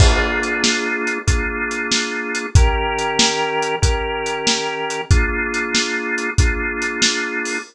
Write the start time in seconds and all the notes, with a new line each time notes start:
0.00 A#3 D4 F4 G#4, kick, crash
0.43 closed hi-hat
0.64 snare
1.07 closed hi-hat
1.27 A#3 D4 F4 G#4, kick, closed hi-hat
1.71 closed hi-hat
1.91 snare
2.35 closed hi-hat
2.55 D#3 C#4 G4 A#4, kick, closed hi-hat
2.99 closed hi-hat
3.19 snare
3.62 closed hi-hat
3.82 D#3 C#4 G4 A#4, kick, closed hi-hat
4.26 closed hi-hat
4.47 snare
4.90 closed hi-hat
5.11 A#3 D4 F4 G#4, kick, closed hi-hat
5.54 closed hi-hat
5.75 snare
6.18 closed hi-hat
6.38 A#3 D4 F4 G#4, kick, closed hi-hat
6.82 closed hi-hat
7.02 snare
7.45 open hi-hat